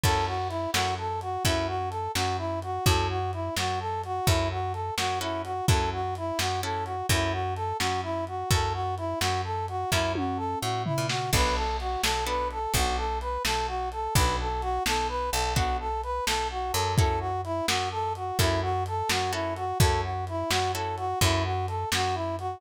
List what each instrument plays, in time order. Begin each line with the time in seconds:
0.04 electric bass (finger) F#2, acoustic guitar (steel) C#4 E4 F#4 A4, brass section A4, kick, crash
0.26 brass section F#4
0.49 brass section E4, closed hi-hat
0.73 electric bass (finger) F#2, acoustic guitar (steel) C#4 E4 F#4 A4, brass section F#4, snare
0.98 brass section A4
1.21 brass section F#4, closed hi-hat
1.45 electric bass (finger) F#2, acoustic guitar (steel) C#4 E4 F#4 A4, brass section E4, kick, closed hi-hat
1.67 brass section F#4
1.90 brass section A4, closed hi-hat
2.15 electric bass (finger) F#2, brass section F#4, snare
2.38 brass section E4
2.62 brass section F#4, closed hi-hat
2.85 electric bass (finger) F#2, acoustic guitar (steel) C#4 E4 F#4 A4, brass section A4, kick, closed hi-hat
3.10 brass section F#4
3.33 brass section E4, closed hi-hat
3.56 electric bass (finger) F#2, brass section F#4, snare
3.80 brass section A4
4.04 brass section F#4, closed hi-hat
4.27 electric bass (finger) F#2, acoustic guitar (steel) C#4 E4 F#4 A4, brass section E4, kick, closed hi-hat
4.51 brass section F#4
4.73 brass section A4, closed hi-hat
4.97 electric bass (finger) F#2, brass section F#4, snare
5.20 acoustic guitar (steel) C#4 E4 F#4 A4, brass section E4
5.44 brass section F#4, closed hi-hat
5.68 electric bass (finger) F#2, acoustic guitar (steel) C#4 E4 F#4 A4, brass section A4, kick, closed hi-hat
5.93 brass section F#4
6.15 brass section E4, closed hi-hat
6.39 electric bass (finger) F#2, brass section F#4, snare
6.63 acoustic guitar (steel) C#4 E4 F#4 A4, brass section A4
6.85 brass section F#4, closed hi-hat
7.09 electric bass (finger) F#2, acoustic guitar (steel) C#4 E4 F#4 A4, brass section E4, kick, closed hi-hat
7.32 brass section F#4
7.55 brass section A4, closed hi-hat
7.79 electric bass (finger) F#2, brass section F#4, snare
8.03 brass section E4
8.27 brass section F#4, closed hi-hat
8.50 electric bass (finger) F#2, acoustic guitar (steel) C#4 E4 F#4 A4, brass section A4, kick, closed hi-hat
8.73 brass section F#4
8.97 brass section E4, closed hi-hat
9.20 electric bass (finger) F#2, brass section F#4, snare
9.44 brass section A4
9.68 brass section F#4, closed hi-hat
9.91 electric bass (finger) F#2, acoustic guitar (steel) C#4 E4 F#4 A4, brass section E4, kick, snare
10.15 brass section F#4, high tom
10.37 brass section A4
10.61 electric bass (finger) A2, brass section F#4
10.85 brass section E4, floor tom
10.98 electric bass (finger) A#2
11.09 brass section F#4, snare
11.33 electric bass (finger) B1, acoustic guitar (steel) B3 D4 F#4 A4, brass section B4, kick, crash
11.55 brass section A4
11.80 brass section F#4, closed hi-hat
12.03 electric bass (finger) B1, brass section A4, snare
12.26 acoustic guitar (steel) B3 D4 F#4 A4, brass section B4
12.51 brass section A4, closed hi-hat
12.74 electric bass (finger) B1, acoustic guitar (steel) B3 D4 F#4 A4, brass section F#4, kick, closed hi-hat
12.97 brass section A4
13.21 brass section B4, closed hi-hat
13.45 electric bass (finger) B1, brass section A4, snare
13.67 brass section F#4
13.92 brass section A4, closed hi-hat
14.14 electric bass (finger) B1, acoustic guitar (steel) B3 D4 F#4 A4, brass section B4, kick, closed hi-hat
14.40 brass section A4
14.62 brass section F#4, closed hi-hat
14.86 electric bass (finger) B1, brass section A4, snare
15.08 brass section B4
15.31 electric bass (finger) B1, brass section A4, closed hi-hat
15.55 acoustic guitar (steel) B3 D4 F#4 A4, brass section F#4, kick, closed hi-hat
15.80 brass section A4
16.03 brass section B4, closed hi-hat
16.26 electric bass (finger) B1, brass section A4, snare
16.51 brass section F#4
16.72 electric bass (finger) F#2, brass section A4, closed hi-hat
16.97 acoustic guitar (steel) C#4 E4 F#4 A4, brass section A4, kick, closed hi-hat
17.20 brass section F#4
17.44 brass section E4, closed hi-hat
17.67 electric bass (finger) F#2, brass section F#4, snare
17.91 brass section A4
18.15 brass section F#4, closed hi-hat
18.39 electric bass (finger) F#2, acoustic guitar (steel) C#4 E4 F#4 A4, brass section E4, kick, closed hi-hat
18.62 brass section F#4
18.86 brass section A4, closed hi-hat
19.09 electric bass (finger) F#2, brass section F#4, snare
19.32 acoustic guitar (steel) C#4 E4 F#4 A4, brass section E4
19.56 brass section F#4, closed hi-hat
19.79 electric bass (finger) F#2, acoustic guitar (steel) C#4 E4 F#4 A4, brass section A4, kick, closed hi-hat
20.03 brass section F#4
20.27 brass section E4, closed hi-hat
20.50 electric bass (finger) F#2, brass section F#4, snare
20.74 acoustic guitar (steel) C#4 E4 F#4 A4, brass section A4
20.97 brass section F#4, closed hi-hat
21.21 electric bass (finger) F#2, acoustic guitar (steel) C#4 E4 F#4 A4, brass section E4, kick, closed hi-hat
21.44 brass section F#4
21.68 brass section A4, closed hi-hat
21.92 electric bass (finger) F#2, brass section F#4, snare
22.14 brass section E4
22.39 brass section F#4, closed hi-hat